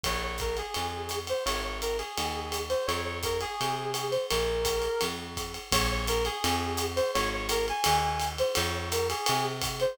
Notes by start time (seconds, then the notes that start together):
0.03 A#1 C#5, kick, ride
0.23 C#5
0.38 A#4, kick, hi-hat pedal, ride
0.57 G#4, ride
0.74 F2, ride
1.09 hi-hat pedal, ride
1.27 C5, ride
1.46 G#1 C#5, ride
1.64 C#5
1.82 A#4, hi-hat pedal, ride
1.98 G#4, ride
2.18 D#2, ride
2.52 hi-hat pedal, ride
2.69 C5, ride
2.86 F2 C#5, ride
3.05 C#5
3.23 A#4, kick, hi-hat pedal, ride
3.41 G#4, ride
3.61 C3, ride
3.94 hi-hat pedal, ride
4.11 C5, ride
4.30 A#1 A#4, ride
4.65 kick, hi-hat pedal, ride
4.82 ride
5.01 F2, ride
5.37 kick, hi-hat pedal, ride
5.54 ride
5.72 A#1 C#5, kick, ride
5.91 C#5
6.07 A#4, hi-hat pedal, ride
6.25 G#4, ride
6.44 F2, ride
6.77 hi-hat pedal, ride
6.96 C5, ride
7.14 G#1 C#5, ride
7.33 C#5
7.49 A#4, hi-hat pedal, ride
7.68 G#5, ride
7.84 D#2, ride
8.20 hi-hat pedal, ride
8.38 C5, ride
8.55 F2 C#5, ride
8.75 C#5
8.92 A#4, hi-hat pedal, ride
9.10 G#4, ride
9.26 C3, ride
9.61 kick, hi-hat pedal, ride
9.80 C5, ride